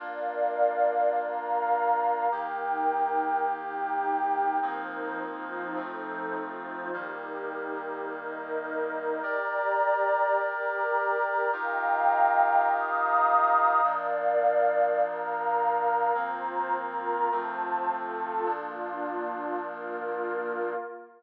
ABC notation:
X:1
M:4/4
L:1/8
Q:1/4=104
K:Bb
V:1 name="Brass Section"
[B,DF]8 | [E,B,G]8 | [F,B,CE]4 [F,A,CE]4 | [E,G,B,]8 |
[GBd]8 | [EFGB]8 | [B,,F,D]8 | [F,B,C]4 [F,A,C]4 |
[B,,F,D]8 |]
V:2 name="Pad 2 (warm)"
[Bdf]4 [Bfb]4 | [EBg]4 [EGg]4 | [F,EBc]2 [F,EFc]2 [F,EAc]2 [F,EFc]2 | [EGB]4 [EBe]4 |
[Gdb]4 [GBb]4 | [efgb]4 [efbe']4 | [Bdf]4 [Bfb]4 | [Fcb]2 [FBb]2 [Fca]2 [FAa]2 |
[B,DF]4 [B,FB]4 |]